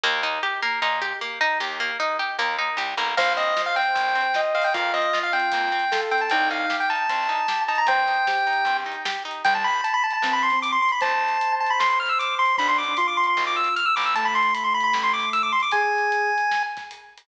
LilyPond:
<<
  \new Staff \with { instrumentName = "Lead 1 (square)" } { \time 4/4 \key bes \major \tempo 4 = 153 r1 | r1 | f''8 ees''8. f''16 g''2 f''16 g''16 | f''8 ees''8. f''16 g''2 g''16 a''16 |
g''8 f''8. g''16 a''2 a''16 bes''16 | g''2~ g''8 r4. | \key c \major g''16 a''16 b''8 a''16 b''16 a''16 a''8 b''16 c'''8 d'''16 c'''16 c'''16 b''16 | a''4. a''16 b''16 c'''16 c'''16 f'''16 e'''16 d'''8 c'''8 |
b''16 c'''16 d'''8 c'''16 d'''16 c'''16 c'''8 d'''16 e'''8 f'''16 e'''16 d'''16 e'''16 | a''16 b''16 c'''8 b''16 c'''16 b''16 b''8 c'''16 d'''8 e'''16 d'''16 c'''16 d'''16 | aes''2~ aes''8 r4. | }
  \new Staff \with { instrumentName = "Ocarina" } { \time 4/4 \key bes \major r1 | r1 | c''2. ees''4 | f'2. a'4 |
ees'4 r2. | c''4 g'4. r4. | \key c \major g8 r4. c'8. c'8. r8 | c''1 |
d'8. d'16 f'2 r4 | a1 | aes'4. r2 r8 | }
  \new Staff \with { instrumentName = "Acoustic Guitar (steel)" } { \time 4/4 \key bes \major bes8 ees'8 g'8 bes8 ees'8 g'8 bes8 ees'8 | g'8 bes8 ees'8 g'8 bes8 ees'8 g'8 bes8 | bes8 c'8 f'8 c'8 bes8 c'8 f'8 c'8 | bes8 c'8 f'8 c'8 bes8 c'8 f'8 c'8 |
c'8 ees'8 g'8 ees'8 c'8 ees'8 g'8 ees'8 | c'8 ees'8 g'8 ees'8 c'8 ees'8 g'8 ees'8 | \key c \major r1 | r1 |
r1 | r1 | r1 | }
  \new Staff \with { instrumentName = "Electric Bass (finger)" } { \clef bass \time 4/4 \key bes \major ees,4 r4 bes,4 r4 | ees,4 r4 ees,4 c,8 b,,8 | bes,,4 r4 bes,,4 r4 | f,4 r4 f,4 r4 |
c,4 r4 c,4 r4 | g,4 r4 g,4 r4 | \key c \major c,4 r4 g,4 r4 | d,4 r4 a,4 r4 |
b,,4 r4 b,,4 r8 a,,8~ | a,,4 r4 a,,4 r4 | r1 | }
  \new DrumStaff \with { instrumentName = "Drums" } \drummode { \time 4/4 r4 r4 r4 r4 | r4 r4 r4 r4 | \tuplet 3/2 { <cymc bd>8 r8 hh8 sn8 r8 hh8 <hh bd>8 sn8 hh8 sn8 r8 hho8 } | \tuplet 3/2 { <hh bd>8 r8 hh8 sn8 r8 hh8 <hh bd>8 sn8 hh8 sn8 r8 hh8 } |
\tuplet 3/2 { <hh bd>8 r8 hh8 sn8 r8 hh8 <hh bd>8 sn8 hh8 sn8 r8 hh8 } | \tuplet 3/2 { <hh bd>8 r8 hh8 sn8 r8 hh8 <hh bd>8 sn8 hh8 sn8 r8 hh8 } | \tuplet 3/2 { <hh bd>8 bd8 hh8 hh8 r8 hh8 sn8 r8 <hh bd sn>8 hh8 r8 hh8 } | \tuplet 3/2 { <hh bd>8 bd8 hh8 hh8 r8 hh8 sn8 r8 <hh sn>8 hh8 r8 hh8 } |
\tuplet 3/2 { <hh bd>8 bd8 hh8 hh8 r8 hh8 sn8 r8 <hh bd sn>8 hh8 r8 hh8 } | \tuplet 3/2 { <hh bd>8 bd8 hh8 hh8 r8 hh8 sn8 r8 <hh sn>8 hh8 r8 hh8 } | \tuplet 3/2 { <hh bd>8 bd8 hh8 hh8 r8 hh8 sn8 r8 <hh bd sn>8 hh8 r8 hh8 } | }
>>